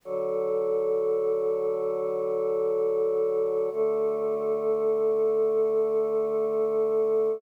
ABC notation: X:1
M:4/4
L:1/8
Q:1/4=65
K:F#m
V:1 name="Choir Aahs"
[D,F,A]8 | [D,A,A]8 |]